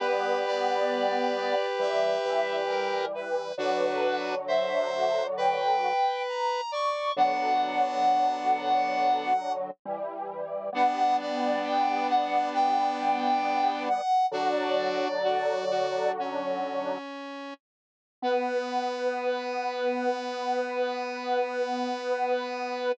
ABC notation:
X:1
M:4/4
L:1/8
Q:1/4=67
K:Bm
V:1 name="Lead 1 (square)"
B d3 e2 ^A B | B2 e2 g2 ^a c' | f6 z2 | f d g f g3 f |
"^rit." d4 z4 | B8 |]
V:2 name="Lead 1 (square)"
[GB]8 | [DF]2 =c2 B3 d | [B,D]5 z3 | [B,D]8 |
"^rit." [DF]2 F F C3 z | B,8 |]
V:3 name="Lead 1 (square)"
[G,B,]4 [E,G,] [E,G,]3 | [D,F,]6 z2 | [D,F,]6 [E,G,]2 | [G,B,]8 |
"^rit." [D,F,]6 z2 | B,8 |]